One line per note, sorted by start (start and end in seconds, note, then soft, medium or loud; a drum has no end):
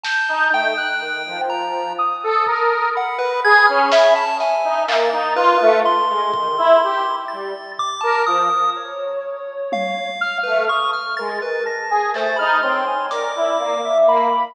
0.03 0.47 A5 medium
0.03 0.70 G6 medium
0.03 snare loud
0.28 0.50 D#4 loud
0.52 0.74 A3 medium
0.52 1.41 G5 loud
0.77 0.99 F#6 loud
1.00 1.22 D#3 medium
1.26 1.92 F3 medium
1.49 1.93 A#5 medium
1.98 2.85 D#6 medium
2.23 2.45 A4 loud
2.46 2.89 A#4 medium
2.46 kick medium
2.95 3.19 F#5 medium
2.95 4.25 B5 medium
3.19 3.40 B4 medium
3.44 3.66 G#4 loud
3.44 3.66 G#6 loud
3.67 3.90 C#4 loud
3.67 3.88 F6 medium
3.92 4.14 E5 loud
3.92 snare loud
4.16 4.37 A5 medium
4.39 5.05 E5 medium
4.39 4.84 G#5 medium
4.39 snare medium
4.64 4.86 D#4 medium
4.87 5.09 A#3 loud
4.87 5.33 A6 medium
4.87 clap loud
5.12 5.34 D#4 loud
5.12 5.35 A#5 medium
5.35 5.57 F4 loud
5.35 5.80 B4 medium
5.61 5.82 A3 loud
5.85 7.16 C6 medium
6.09 6.31 G#3 medium
6.33 6.55 D#3 medium
6.33 kick loud
6.57 6.79 E4 loud
6.83 7.05 G4 medium
7.28 7.53 G3 medium
7.28 7.72 A6 medium
7.79 8.01 D6 loud
7.79 floor tom medium
8.01 8.25 A#4 medium
8.01 8.22 A5 medium
8.26 8.48 F3 medium
8.26 8.70 D#6 medium
8.76 10.07 C#5 medium
9.72 10.38 F5 medium
9.72 high tom loud
10.21 10.65 F6 loud
10.43 10.68 A3 medium
10.43 10.65 B4 medium
10.69 10.91 C#6 medium
10.69 10.91 D#6 medium
10.93 11.15 F6 medium
11.17 11.40 G#3 medium
11.17 11.62 A#4 loud
11.17 11.39 A6 medium
11.42 11.64 B4 medium
11.65 11.87 A5 medium
11.65 12.10 A#6 medium
11.90 12.11 G#4 medium
11.90 12.13 G#5 medium
12.13 12.35 A3 medium
12.13 12.38 C5 medium
12.13 12.36 A6 loud
12.13 clap medium
12.36 12.61 D#4 loud
12.36 12.58 B5 medium
12.36 12.60 F6 loud
12.63 12.85 C4 medium
12.63 12.85 C#5 medium
12.63 13.06 C6 medium
12.87 13.09 G#5 medium
13.11 13.33 A#4 medium
13.11 13.77 D5 medium
13.11 13.98 D6 medium
13.11 closed hi-hat medium
13.36 13.57 E4 medium
13.59 13.81 A#3 medium
13.84 14.06 E5 loud
14.06 14.28 A#3 loud
14.06 14.52 B5 loud